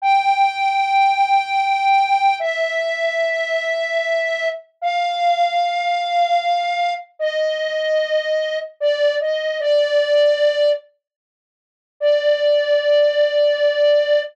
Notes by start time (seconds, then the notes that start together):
0.02 G5
2.40 E5
4.82 F5
7.19 D#5
8.80 D5
9.20 D#5
9.60 D5
12.00 D5